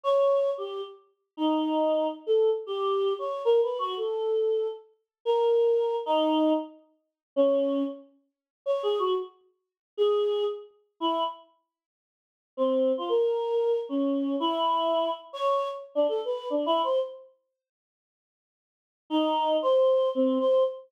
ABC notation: X:1
M:5/8
L:1/16
Q:1/4=115
K:none
V:1 name="Choir Aahs"
^c4 G2 z4 | ^D6 z A2 z | G4 ^c2 (3^A2 B2 ^F2 | A6 z4 |
^A6 ^D4 | z6 ^C4 | z6 (3^c2 ^G2 ^F2 | z6 ^G4 |
z4 E2 z4 | z6 C3 F | ^A6 ^C4 | E6 z ^c3 |
z2 D A B2 (3D2 E2 c2 | z10 | z6 ^D4 | c4 C2 c2 z2 |]